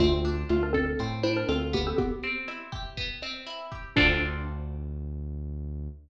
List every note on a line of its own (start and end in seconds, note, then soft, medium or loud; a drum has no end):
0.00 0.44 D2 loud
0.00 0.48 A3 medium
0.00 0.99 C4 medium
0.00 0.48 F4 loud
0.00 kick medium
0.00 cross-stick loud
0.00 closed hi-hat medium
0.25 1.23 D4 medium
0.25 closed hi-hat medium
0.49 0.95 D2 medium
0.49 0.62 A3 medium
0.49 1.48 F4 medium
0.49 0.62 F4 medium
0.49 closed hi-hat medium
0.63 0.75 D4 medium
0.63 0.75 A#4 medium
0.73 1.08 C4 medium
0.73 1.08 A4 medium
0.73 1.92 A4 medium
0.73 kick medium
0.73 cross-stick medium
0.73 closed hi-hat medium
0.99 1.44 A2 medium
0.99 1.94 C4 medium
0.99 kick medium
0.99 closed hi-hat medium
1.23 1.94 D4 medium
1.23 1.35 E4 medium
1.23 1.35 C5 medium
1.23 closed hi-hat medium
1.37 1.48 D4 medium
1.37 1.48 A#4 medium
1.49 1.93 D2 medium
1.49 1.69 C4 medium
1.49 1.96 F4 medium
1.49 1.69 A4 medium
1.49 cross-stick medium
1.49 closed hi-hat medium
1.73 1.86 A#3 medium
1.73 2.97 B3 medium
1.73 1.86 G4 medium
1.73 kick medium
1.73 closed hi-hat medium
1.87 1.98 C4 medium
1.87 1.98 A4 medium
1.98 3.12 B3 medium
1.98 3.12 G4 loud
1.98 kick medium
1.98 closed hi-hat medium
2.23 3.22 C4 medium
2.23 closed hi-hat medium
2.48 3.46 E4 medium
2.48 cross-stick medium
2.48 closed hi-hat loud
2.72 3.71 G4 medium
2.72 kick medium
2.72 closed hi-hat medium
2.97 3.91 B3 medium
2.97 kick medium
2.97 closed hi-hat medium
3.22 3.93 C4 medium
3.22 cross-stick medium
3.22 closed hi-hat medium
3.46 3.94 E4 medium
3.46 closed hi-hat medium
3.72 3.95 G4 medium
3.72 kick medium
3.72 closed hi-hat medium
3.96 5.88 D2 loud
3.96 5.88 C4 loud
3.96 5.87 D4 loud
3.96 5.88 D4 loud
3.96 5.88 F4 loud
3.96 5.88 A4 medium
3.96 kick loud
3.96 crash loud